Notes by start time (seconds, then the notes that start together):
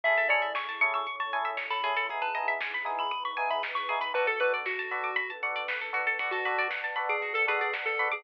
0.03 A1 C#4 E4 G#4 A4 E5, kick, closed hi-hat
0.17 A4, closed hi-hat
0.29 C#4 E4 G#4 A4 C#5 D5, open hi-hat
0.42 E5, closed hi-hat
0.55 G#5 C#6, kick, snare
0.68 A5, closed hi-hat
0.81 C#4 E4 G#4 A4 C#6, open hi-hat
0.93 C#6 E6, closed hi-hat
1.06 C#4 E4 A4 C#5 C#6, kick, closed hi-hat
1.19 A5 C#6, closed hi-hat
1.32 C#4 E4 G#4 A4 G#5, open hi-hat
1.45 E5, closed hi-hat
1.57 C#5, kick, snare
1.70 A4 B5, closed hi-hat
1.83 E2 C#4 E4 G#4 A4, open hi-hat
1.96 A4, closed hi-hat
2.09 B3 D#4 E4 G#4, kick, closed hi-hat
2.22 B4 A5, closed hi-hat
2.35 B3 D#4 E4 G#4 D#5, open hi-hat
2.48 E5, closed hi-hat
2.60 G#5, kick, snare
2.73 B5, closed hi-hat
2.85 B3 D#4 E4 G#4 D#6, open hi-hat
2.98 B5 E6, closed hi-hat
3.11 B3 D#4 G#4 B4 D#6, kick, closed hi-hat
3.25 B5 C#6, closed hi-hat
3.37 B3 D#4 E4 G#4 G#5, open hi-hat
3.50 E5 B5, closed hi-hat
3.63 D#5, kick, snare
3.75 B4 C#6, closed hi-hat
3.89 B3 D#4 E4 G#4, open hi-hat
4.01 B4 B5, closed hi-hat
4.14 B1 B3 D4 F#4 A4 B4, kick, closed hi-hat
4.27 A4, closed hi-hat
4.40 B3 D4 F#4 A4 B4, open hi-hat
4.53 D5, closed hi-hat
4.65 F#4 F#5, kick, snare
4.78 A5, closed hi-hat
4.91 B3 D4 F#4 A4 B5, open hi-hat
5.04 D6, closed hi-hat
5.16 B3 D4 A4 B4 B5, kick, closed hi-hat
5.30 A5, closed hi-hat
5.43 B3 D4 F#4 A4 F#5, open hi-hat
5.55 D5, closed hi-hat
5.68 B4, kick, snare
5.81 A4, closed hi-hat
5.93 B3 D4 F#4 A4, open hi-hat
6.07 A4, closed hi-hat
6.19 B1 B3 D4 F#4 A4 B4 D5 F#5 A5, kick, closed hi-hat
6.31 F#4 A4, closed hi-hat
6.45 B3 D4 F#4 A4 B4, open hi-hat
6.58 D5, closed hi-hat
6.70 F#5, kick, snare
6.84 A5, closed hi-hat
6.96 B3 D4 F#4 A4 B5, open hi-hat
7.09 G#4 D6, closed hi-hat
7.22 F#4, kick, closed hi-hat
7.34 A4, closed hi-hat
7.47 B3 D4 F#4 G#4 A4 B4, open hi-hat
7.60 G#4 D5, closed hi-hat
7.73 F#5, kick, snare
7.85 A4 A5, closed hi-hat
7.99 B3 D4 F#4 A4 B5, open hi-hat
8.11 G#4 D6, closed hi-hat